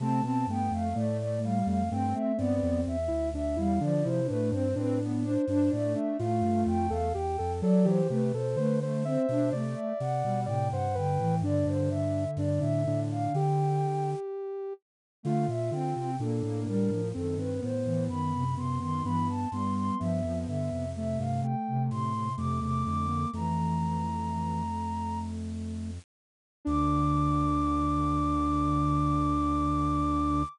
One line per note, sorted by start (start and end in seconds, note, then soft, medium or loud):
0.00 0.21 C3 medium
0.00 0.24 A3 medium
0.00 0.21 C4 loud
0.00 0.23 A5 medium
0.23 0.45 B2 medium
0.23 0.46 B3 medium
0.23 0.47 C4 loud
0.23 0.46 A5 medium
0.47 0.70 G2 medium
0.47 0.89 A3 medium
0.47 0.72 B3 medium
0.47 0.72 G5 medium
0.71 0.94 F2 medium
0.71 0.94 A3 loud
0.71 0.95 F5 medium
0.94 1.63 A2 medium
0.94 1.38 A3 loud
0.94 1.59 A3 medium
0.94 1.17 D5 medium
1.18 1.40 D5 medium
1.42 1.83 G3 medium
1.42 1.66 F5 medium
1.66 1.89 F2 medium
1.66 1.89 A3 medium
1.66 1.89 F5 medium
1.91 2.14 G2 medium
1.91 2.14 A3 medium
1.91 2.32 C4 loud
1.91 2.14 G5 medium
2.14 2.38 A3 medium
2.14 2.36 E5 medium
2.38 2.61 G2 medium
2.38 2.80 B3 loud
2.38 2.97 C4 medium
2.38 2.81 D5 medium
2.63 2.85 F2 loud
2.87 3.09 E2 medium
2.87 3.28 E5 loud
3.08 3.32 D2 medium
3.08 3.30 E4 medium
3.33 3.56 D2 medium
3.33 3.57 D4 medium
3.33 3.57 E5 medium
3.56 3.79 E2 medium
3.56 3.79 G3 medium
3.56 3.79 E4 medium
3.56 3.81 F5 medium
3.80 4.03 D3 loud
3.80 4.20 F3 loud
3.80 4.03 D4 medium
3.80 4.04 D5 loud
4.04 4.28 C3 medium
4.04 4.27 E4 medium
4.04 4.26 C5 loud
4.27 4.53 A2 medium
4.27 4.51 A3 loud
4.27 4.67 D4 medium
4.27 4.49 B4 loud
4.51 4.74 G2 loud
4.51 4.76 C4 medium
4.51 4.74 C5 loud
4.75 5.37 A2 medium
4.75 4.99 C4 loud
4.75 5.35 D4 medium
4.75 4.99 B4 medium
5.02 5.25 B3 medium
5.23 5.45 D4 loud
5.23 5.70 C5 medium
5.47 5.70 G2 medium
5.47 5.71 D4 loud
5.47 5.70 D4 medium
5.71 5.95 A2 medium
5.71 7.08 A3 loud
5.71 5.93 D4 medium
5.71 5.94 D5 loud
5.94 6.17 D4 medium
5.94 6.16 E5 medium
6.19 6.42 A2 loud
6.19 6.87 F4 medium
6.19 6.62 F5 medium
6.42 6.64 G2 medium
6.66 6.89 F2 loud
6.66 6.90 G5 medium
6.90 7.13 E2 loud
6.90 7.13 A4 medium
6.90 7.13 F5 medium
7.13 7.38 E2 medium
7.13 7.37 G4 medium
7.13 7.52 G5 medium
7.38 7.62 F2 medium
7.38 7.61 A4 medium
7.62 7.85 F#3 loud
7.62 8.01 F#3 loud
7.62 7.85 A4 medium
7.62 7.85 D5 loud
7.85 8.08 E3 loud
7.85 8.08 G4 medium
7.85 8.09 C5 medium
8.09 8.32 C3 medium
8.09 8.32 A3 medium
8.09 8.32 G4 medium
8.09 8.33 B4 medium
8.34 8.56 B2 medium
8.34 8.57 A4 medium
8.34 8.57 C5 medium
8.56 9.17 D3 medium
8.56 8.79 A3 medium
8.56 8.78 B4 medium
8.56 8.79 C5 medium
8.81 9.03 A3 medium
8.81 9.05 C5 medium
9.04 9.26 C4 medium
9.04 9.53 C5 medium
9.04 9.50 E5 medium
9.29 9.51 B2 medium
9.29 9.53 D4 loud
9.52 9.75 C3 medium
9.52 9.93 A3 loud
9.52 9.74 D5 medium
9.52 10.40 D5 medium
9.75 9.97 E5 medium
10.00 10.23 C3 medium
10.00 10.42 F#5 medium
10.24 10.47 B2 medium
10.24 10.46 G3 loud
10.46 10.70 A2 medium
10.46 10.88 C3 loud
10.46 10.68 D5 medium
10.46 10.70 G5 medium
10.72 10.95 G2 medium
10.72 10.95 C5 medium
10.72 10.94 F#5 medium
10.94 11.18 G2 medium
10.94 11.18 D3 medium
10.94 11.35 B4 medium
10.94 11.37 G5 medium
11.19 11.41 A2 medium
11.19 11.42 E3 loud
11.42 11.64 G2 loud
11.42 11.89 D3 loud
11.42 12.24 D4 medium
11.42 11.66 D5 loud
11.66 12.26 G2 loud
11.66 11.89 C5 medium
11.90 13.86 D3 medium
11.90 12.31 E5 medium
12.37 12.59 G2 loud
12.37 12.60 D4 medium
12.37 12.60 D5 medium
12.60 12.85 A2 medium
12.60 12.83 D4 medium
12.60 13.00 E5 medium
12.86 13.28 A2 medium
12.86 13.33 D4 medium
13.11 13.34 F5 medium
13.33 14.15 D3 medium
13.33 14.73 G4 medium
13.33 14.10 G5 medium
15.23 15.47 D3 loud
15.23 15.46 A3 loud
15.23 15.70 F4 medium
15.23 15.47 F5 medium
15.48 15.71 A#2 medium
15.48 15.71 E5 medium
15.70 15.94 D3 medium
15.70 16.16 C4 medium
15.70 16.11 F4 medium
15.70 15.94 G5 medium
15.94 16.18 C3 medium
15.94 16.17 G5 medium
16.19 16.42 A#2 loud
16.19 16.43 A#3 medium
16.19 17.02 D4 medium
16.19 16.60 A4 medium
16.43 16.65 A2 medium
16.43 16.67 A#3 medium
16.66 16.89 A2 medium
16.66 16.90 G3 medium
16.66 17.08 A#4 medium
16.90 17.13 A2 medium
16.90 17.13 F3 medium
17.14 17.38 F#2 medium
17.14 17.72 D#3 medium
17.14 17.37 C4 medium
17.14 17.37 A4 medium
17.38 17.61 G2 medium
17.38 17.61 C4 medium
17.38 17.60 B4 medium
17.62 17.85 A2 medium
17.62 18.44 B3 medium
17.62 18.03 C5 medium
17.85 18.08 A2 medium
17.85 18.08 E3 medium
18.09 19.02 F#2 medium
18.09 18.33 D#3 medium
18.09 18.54 B5 medium
18.34 18.55 C3 medium
18.56 18.79 C3 medium
18.56 18.79 B3 medium
18.56 18.79 C6 medium
18.80 19.04 D#3 loud
18.80 19.02 B3 medium
18.80 19.03 C6 medium
19.04 19.46 G2 medium
19.04 19.29 E3 loud
19.04 19.48 B3 medium
19.04 19.27 B5 medium
19.29 19.51 A5 medium
19.51 19.91 G2 medium
19.51 19.96 G3 medium
19.51 19.98 B3 medium
19.51 19.74 C6 medium
19.75 19.98 C6 medium
19.99 20.23 G2 medium
19.99 20.21 F3 medium
19.99 20.86 B3 medium
19.99 20.38 E5 medium
20.24 20.46 F2 medium
20.24 20.47 F3 medium
20.46 20.70 G2 medium
20.46 20.69 D3 medium
20.46 20.89 E5 medium
20.72 21.17 F2 medium
20.72 20.94 C3 medium
20.94 21.55 C3 medium
20.94 21.19 A3 medium
20.94 21.19 E5 medium
21.18 21.42 G2 medium
21.18 21.42 A3 medium
21.18 21.41 F5 medium
21.42 22.29 A3 medium
21.42 21.82 G5 medium
21.68 21.90 C3 loud
21.91 22.32 A2 medium
21.91 22.13 C3 medium
21.91 22.33 C6 medium
22.13 22.36 C3 medium
22.37 22.60 F2 medium
22.37 22.61 C3 medium
22.37 22.60 A3 medium
22.37 22.60 D6 medium
22.61 22.84 E2 medium
22.61 22.84 C3 medium
22.61 22.83 A3 medium
22.61 22.84 D6 medium
22.84 23.26 F2 medium
22.84 23.25 D3 medium
22.84 23.06 A3 medium
22.84 23.28 D6 medium
23.08 23.31 A#3 medium
23.33 25.99 F2 medium
23.33 24.63 E3 medium
23.33 25.91 A3 medium
23.33 25.19 A#5 medium
26.65 30.44 D2 loud
26.65 30.43 D3 loud
26.65 30.42 D4 loud
26.65 30.44 D6 loud